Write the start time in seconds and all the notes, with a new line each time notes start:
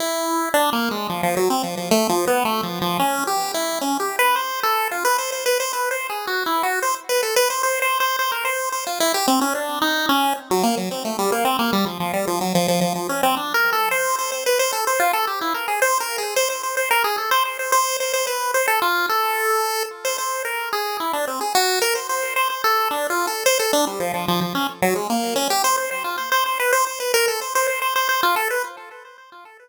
0.00 E4
0.54 D4
0.73 A#3
0.91 G#3
1.09 F3
1.23 F3
1.37 F#3
1.50 C4
1.63 F3
1.77 F3
1.91 A3
2.09 F3
2.27 B3
2.45 A3
2.63 F3
2.81 F3
2.99 C#4
3.27 G4
3.54 E4
3.81 C#4
4.00 G4
4.19 B4
4.36 C5
4.63 A4
4.91 F4
5.05 B4
5.18 C5
5.32 C5
5.46 B4
5.60 C5
5.73 B4
5.91 C5
6.10 G#4
6.27 F#4
6.46 E4
6.63 F#4
6.82 C5
7.09 B4
7.23 A4
7.36 B4
7.50 C5
7.63 C5
7.82 C5
8.00 C5
8.19 C5
8.32 A#4
8.45 C5
8.72 C5
8.87 F4
9.00 E4
9.14 G4
9.28 C4
9.41 C#4
9.55 D4
9.82 D#4
10.09 C#4
10.51 F#3
10.63 A#3
10.77 F#3
10.91 C4
11.05 A3
11.19 G3
11.32 A#3
11.45 C4
11.59 A#3
11.73 G3
11.86 F3
12.00 F3
12.13 G3
12.27 F3
12.41 F#3
12.55 F3
12.68 F3
12.81 F3
12.95 F3
13.09 C#4
13.23 C4
13.37 D4
13.54 A#4
13.73 A4
13.91 C5
14.19 C5
14.32 C5
14.46 B4
14.59 C5
14.73 A4
14.87 C5
15.00 F4
15.13 A4
15.27 G4
15.41 E4
15.54 A#4
15.68 G#4
15.82 C5
16.00 A#4
16.18 G#4
16.36 C5
16.50 C5
16.63 C5
16.77 C5
16.91 A#4
17.04 G#4
17.18 A4
17.31 C5
17.45 C5
17.59 C5
17.72 C5
18.00 C5
18.14 C5
18.27 B4
18.54 C5
18.68 A4
18.82 F4
19.09 A4
20.05 C5
20.18 C5
20.45 A#4
20.73 G#4
21.00 E4
21.13 D4
21.27 C4
21.41 G#4
21.55 F#4
21.82 A#4
21.95 C5
22.09 C5
22.36 C5
22.50 C5
22.64 A4
22.91 D4
23.10 F4
23.27 A4
23.46 C5
23.59 A4
23.73 D4
23.87 G3
24.00 F3
24.14 F3
24.28 F3
24.41 F3
24.55 C#4
24.82 F#3
24.95 G#3
25.10 A#3
25.36 C#4
25.50 G4
25.64 C5
25.78 C5
25.91 C5
26.04 F4
26.18 C5
26.32 C5
26.46 C5
26.60 B4
26.73 C5
26.87 C5
27.00 B4
27.14 A#4
27.28 A4
27.41 C5
27.55 C5
27.67 C5
27.82 C5
27.96 C5
28.09 C5
28.23 F4
28.36 A4
28.50 B4